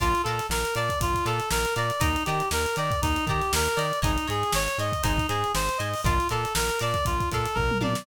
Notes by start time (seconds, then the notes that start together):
0.00 A#1 F4 D5 F5 A5 A#5, kick, closed hi-hat
0.15 closed hi-hat
0.23 A#2 A4 D5 F5, closed hi-hat
0.28 A5 A#5
0.39 snare, closed hi-hat
0.49 A#1 A#4, snare
0.65 closed hi-hat
0.75 A#2 D5 F5 A5 A#5, closed hi-hat
0.89 kick, closed hi-hat
1.00 A#1 F4, kick, closed hi-hat
1.14 kick, closed hi-hat
1.25 A#2 A4 D5 F5 A5 A#5, closed hi-hat
1.40 closed hi-hat
1.51 A#1 A#4, snare
1.65 snare, closed hi-hat
1.76 A#2 D5 F5 A5 A#5, closed hi-hat
1.90 closed hi-hat
2.00 D#2 D#4 D5 D#5 G5 A#5, kick, closed hi-hat
2.16 closed hi-hat
2.25 D#3 G4 D5 D#5 G5, closed hi-hat
2.29 A#5
2.40 closed hi-hat
2.51 D#2 A#4, snare
2.66 closed hi-hat
2.76 D#3 D5 D#5 G5 A#5, closed hi-hat
2.91 kick, closed hi-hat
3.02 D#2 D#4, kick, closed hi-hat
3.16 closed hi-hat
3.27 D#3 G4 D5 D#5 G5, kick, closed hi-hat
3.31 A#5
3.41 snare, closed hi-hat
3.53 D#2 A#4, snare
3.66 closed hi-hat
3.76 D#3 D5 D#5 G5 A#5, closed hi-hat
3.93 closed hi-hat
4.02 G#1 D#4 C#5 D#5 G#5, kick, closed hi-hat
4.18 closed hi-hat
4.28 G#2 G#4 C#5 D#5 G#5, closed hi-hat
4.43 closed hi-hat
4.52 G#1 C#5, snare
4.68 snare, closed hi-hat
4.78 G#2 C#5 D#5 G#5, closed hi-hat
4.92 kick, closed hi-hat
5.03 G#1 D#4 C5 D#5 G#5, kick, closed hi-hat
5.17 kick, snare, closed hi-hat
5.29 G#2 G#4 C5 D#5 G#5, closed hi-hat
5.44 closed hi-hat
5.55 G#1 C5, snare
5.69 closed hi-hat
5.78 G#2 C5 D#5 G#5, closed hi-hat
5.94 open hi-hat
6.04 A#1 F4 A#4 D5 F5 A5, kick, closed hi-hat
6.20 closed hi-hat
6.29 A#2 A4 A#4 D5 F5 A5, closed hi-hat
6.45 closed hi-hat
6.55 A#1 A#4, snare
6.69 closed hi-hat
6.79 A#2 A#4 D5 F5 A5, snare, closed hi-hat
6.94 kick, closed hi-hat
7.05 A#1 F4, kick, closed hi-hat
7.20 kick, closed hi-hat
7.32 A#2 A4 A#4 D5 F5 A5, kick, closed hi-hat
7.45 closed hi-hat
7.55 A#1 A#4, kick, floor tom
7.71 mid tom
7.81 A#2 A#4 D5 F5 A5, high tom
7.95 snare